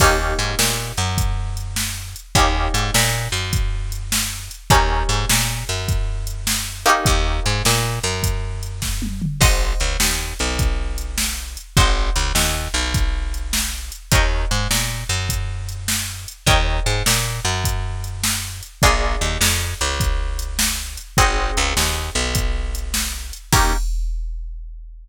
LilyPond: <<
  \new Staff \with { instrumentName = "Acoustic Guitar (steel)" } { \time 12/8 \key ees \major \tempo 4. = 102 <bes des' ees' g'>1. | <bes des' ees' g'>1. | <bes des' ees' g'>1~ <bes des' ees' g'>4. <bes des' ees' g'>8~ | <bes des' ees' g'>1. |
<c'' ees'' ges'' aes''>1. | <c'' ees'' ges'' aes''>1. | <bes' des'' ees'' g''>1. | <bes' des'' ees'' g''>1. |
<bes d' f' aes'>1. | <c' ees' ges' aes'>1. | <bes des' ees' g'>4. r1 r8 | }
  \new Staff \with { instrumentName = "Electric Bass (finger)" } { \clef bass \time 12/8 \key ees \major ees,4 aes,8 bes,4 ges,2.~ ges,8 | ees,4 aes,8 bes,4 ges,2.~ ges,8 | ees,4 aes,8 bes,4 ges,2.~ ges,8 | ees,4 aes,8 bes,4 ges,2.~ ges,8 |
aes,,4 des,8 ees,4 b,,2.~ b,,8 | aes,,4 des,8 ees,4 b,,2.~ b,,8 | ees,4 aes,8 bes,4 ges,2.~ ges,8 | ees,4 aes,8 bes,4 ges,2.~ ges,8 |
bes,,4 ees,8 f,4 des,2.~ des,8 | aes,,4 des,8 ees,4 b,,2.~ b,,8 | ees,4. r1 r8 | }
  \new DrumStaff \with { instrumentName = "Drums" } \drummode { \time 12/8 <cymc bd>4 hh8 sn4 hh8 <hh bd>4 hh8 sn4 hh8 | <hh bd>4 hh8 sn4 hh8 <hh bd>4 hh8 sn4 hh8 | <hh bd>4 hh8 sn4 hh8 <hh bd>4 hh8 sn4 hh8 | <hh bd>4 hh8 sn4 hh8 <hh bd>4 hh8 <bd sn>8 tommh8 toml8 |
<cymc bd>4 hh8 sn4 hh8 <hh bd>4 hh8 sn4 hh8 | <hh bd>4 hh8 sn4 hh8 <hh bd>4 hh8 sn4 hh8 | <hh bd>4 hh8 sn4 hh8 <hh bd>4 hh8 sn4 hh8 | <hh bd>4 hh8 sn4 hh8 <hh bd>4 hh8 sn4 hh8 |
<hh bd>4 hh8 sn4 hh8 <hh bd>4 hh8 sn4 hh8 | <hh bd>4 hh8 sn4 hh8 <hh bd>4 hh8 sn4 hh8 | <cymc bd>4. r4. r4. r4. | }
>>